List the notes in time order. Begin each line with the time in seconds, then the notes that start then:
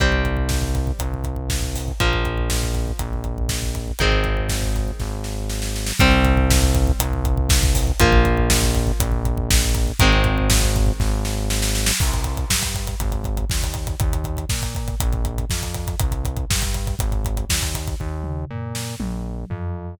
0.00 C2 G3 C4, kick, closed hi-hat
0.12 kick
0.25 kick, closed hi-hat
0.37 kick
0.49 kick, snare
0.62 kick
0.75 kick, closed hi-hat
0.87 kick
0.99 C2, kick, closed hi-hat
1.14 kick
1.24 kick, closed hi-hat
1.36 kick
1.50 kick, snare
1.62 kick
1.75 kick, open hi-hat
1.88 kick
2.00 A#1 F3 A#3, kick, closed hi-hat
2.13 kick
2.25 kick, closed hi-hat
2.38 kick
2.50 kick, snare
2.63 kick
2.74 kick, closed hi-hat
2.88 kick
2.99 A#1, kick, closed hi-hat
3.13 kick
3.24 kick, closed hi-hat
3.38 kick
3.49 kick, snare
3.62 kick
3.75 kick, closed hi-hat
3.88 kick
3.99 G#1 D#3 G#3 C4, kick, closed hi-hat
4.12 kick
4.24 kick, closed hi-hat
4.37 kick
4.49 kick, snare
4.62 kick
4.76 kick, closed hi-hat
4.88 kick
4.99 G#1, kick, snare
5.24 snare
5.49 snare
5.62 snare
5.76 snare
5.86 snare
5.99 C2 G3 C4, kick, closed hi-hat
6.12 kick
6.25 kick, closed hi-hat
6.37 kick
6.50 kick, snare
6.62 kick
6.75 kick, closed hi-hat
6.87 kick
7.00 C2, kick, closed hi-hat
7.13 kick
7.25 kick, closed hi-hat
7.37 kick
7.49 kick, snare
7.63 kick
7.75 kick, open hi-hat
7.87 kick
8.00 A#1 F3 A#3, kick, closed hi-hat
8.12 kick
8.25 kick, closed hi-hat
8.37 kick
8.50 kick, snare
8.63 kick
8.75 kick, closed hi-hat
8.87 kick
9.00 A#1, kick, closed hi-hat
9.12 kick
9.25 kick, closed hi-hat
9.38 kick
9.51 kick, snare
9.62 kick
9.75 kick, closed hi-hat
9.87 kick
9.99 G#1 D#3 G#3 C4, kick, closed hi-hat
10.13 kick
10.24 kick, closed hi-hat
10.38 kick
10.50 kick, snare
10.62 kick
10.76 kick, closed hi-hat
10.86 kick
11.00 G#1, kick, snare
11.25 snare
11.50 snare
11.62 snare
11.75 snare
11.86 snare
12.00 C2, kick, crash
12.13 kick, closed hi-hat
12.24 kick, closed hi-hat
12.37 kick, closed hi-hat
12.50 G2, kick, snare
12.63 kick, closed hi-hat
12.74 kick, closed hi-hat
12.87 kick, closed hi-hat
13.00 G#1, kick, closed hi-hat
13.12 kick, closed hi-hat
13.24 kick, closed hi-hat
13.37 kick, closed hi-hat
13.50 D#2, kick, snare
13.63 kick, closed hi-hat
13.74 kick, closed hi-hat
13.87 kick, closed hi-hat
14.00 D#2, kick, closed hi-hat
14.13 kick, closed hi-hat
14.24 kick, closed hi-hat
14.37 kick, closed hi-hat
14.49 A#2, kick, snare
14.62 kick, closed hi-hat
14.75 kick, closed hi-hat
14.88 kick, closed hi-hat
15.00 A#1, kick, closed hi-hat
15.12 kick, closed hi-hat
15.25 kick, closed hi-hat
15.38 kick, closed hi-hat
15.50 F2, kick, snare
15.63 kick, closed hi-hat
15.74 kick, closed hi-hat
15.87 kick, closed hi-hat
15.99 C2, kick, closed hi-hat
16.12 kick, closed hi-hat
16.25 kick, closed hi-hat
16.37 kick, closed hi-hat
16.50 G2, kick, snare
16.62 kick, closed hi-hat
16.74 kick, closed hi-hat
16.87 kick, closed hi-hat
16.99 G#1, kick, closed hi-hat
17.12 kick, closed hi-hat
17.25 kick, closed hi-hat
17.37 kick, closed hi-hat
17.50 D#2, kick, snare
17.62 kick, closed hi-hat
17.74 kick, closed hi-hat
17.88 kick, closed hi-hat
18.00 D#2, kick
18.24 mid tom
18.50 A#2, floor tom
18.75 snare
19.00 A#1, high tom
19.50 F2, floor tom